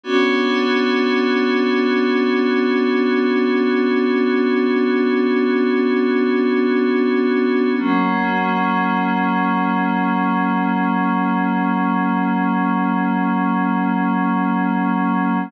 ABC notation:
X:1
M:4/4
L:1/8
Q:1/4=62
K:Bm
V:1 name="Pad 5 (bowed)"
[B,CDF]8- | [B,CDF]8 | [F,^A,C]8- | [F,^A,C]8 |]